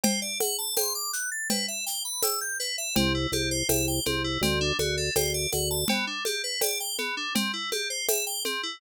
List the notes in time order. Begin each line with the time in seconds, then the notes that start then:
0.04 C5, cowbell, low conga, shaker
0.22 D5
0.40 F#5, high conga, shaker
0.58 A5
0.77 C6, tambourine, cowbell, high conga, shaker
0.95 D6
1.13 F#6, shaker
1.32 A6
1.50 B4, cowbell, low conga, shaker
1.68 E5
1.86 G5, shaker
2.05 B5
2.23 E6, tambourine, cowbell, high conga, shaker
2.41 G6
2.60 B4, shaker
2.78 E5
2.96 C2 C4, cowbell, low conga, shaker
3.15 E4
3.32 C2 G4, high conga, shaker
3.51 C5
3.69 C2 E5, tambourine, cowbell, high conga, shaker
3.88 G5
4.05 C2 C4, high conga, shaker
4.24 E4
4.41 D2 C4, cowbell, low conga, shaker
4.61 D4
4.79 D2 F#4, high conga, shaker
4.97 A4
5.15 D2 C5, tambourine, cowbell, high conga, shaker
5.34 D5
5.52 D2 F#5, high conga, shaker
5.71 A5
5.88 B3, cowbell, low conga, shaker
6.07 D4
6.25 G4, high conga, shaker
6.44 B4
6.61 D5, tambourine, cowbell, high conga, shaker
6.80 G5
6.98 B3, high conga, shaker
7.17 D4
7.35 C4, cowbell, low conga, shaker
7.54 E4
7.72 G4, high conga, shaker
7.90 C5
8.08 E5, tambourine, cowbell, high conga, shaker
8.27 G5
8.45 C4, high conga, shaker
8.63 E4